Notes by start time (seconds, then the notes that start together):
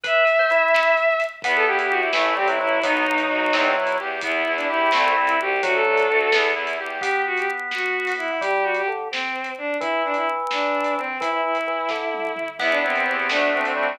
0.03 B4 E5, kick, closed hi-hat
0.27 closed hi-hat
0.39 C5
0.50 E4, closed hi-hat
0.74 snare
0.97 closed hi-hat
1.20 closed hi-hat
1.42 E2 B3 B4, kick, closed hi-hat
1.55 A4
1.66 E2 E4 G4
1.79 G4, closed hi-hat
1.90 E2 F#4 G4
2.00 E4
2.13 A1 E3 A3 E4, snare
2.36 A1 G3 C4 G4
2.47 F#3 E4, closed hi-hat
2.60 A1 F#3 E4
2.83 B1 F#3 B3 D#4, kick, closed hi-hat
3.06 B1 D#4
3.18 closed hi-hat
3.30 B1 F#4
3.53 E2 C4, snare
3.76 E2 E4
3.87 closed hi-hat
4.00 E2 G4
4.21 E2 B3 E4, kick, closed hi-hat
4.46 E2 E4
4.56 D4, closed hi-hat
4.69 E2 E4 G4
4.91 C2 A3 C4, snare
5.16 C2 C4
5.27 E4, closed hi-hat
5.39 C2 F#4 G4
5.62 D2 F#3 A3 F#4, kick, closed hi-hat
5.74 A4
5.85 D2 D4
5.97 closed hi-hat
6.08 D2 F#4
6.32 E2 B3, snare
6.55 E2 E4
6.67 closed hi-hat
6.78 E2 G4
7.01 B3 G4, kick, closed hi-hat
7.26 F#4
7.37 G4, closed hi-hat
7.71 F#4, snare
8.07 open hi-hat
8.18 E4
8.41 G3 G4, kick, closed hi-hat
8.63 F#4
8.75 G4, closed hi-hat
8.88 D3
9.11 C4, snare
9.44 closed hi-hat
9.58 D4
9.80 E3 E4, kick, closed hi-hat
10.04 D4
10.14 E4, closed hi-hat
10.51 D4, snare
10.84 closed hi-hat
10.97 C4
11.20 E3 E4, kick, closed hi-hat
11.30 E4
11.44 E4
11.55 closed hi-hat
11.67 E3
11.89 D3, kick, snare
12.14 high tom
12.36 mid tom
12.59 E2 B3 E4, kick, crash
12.70 D4
12.82 E2 C4 E4
12.95 C4, closed hi-hat
13.05 E2 C4 G4
13.19 C4
13.29 D2 A3 D4, snare
13.53 D2 C4 D4
13.63 C4, closed hi-hat
13.76 D2 G3 C4 F#4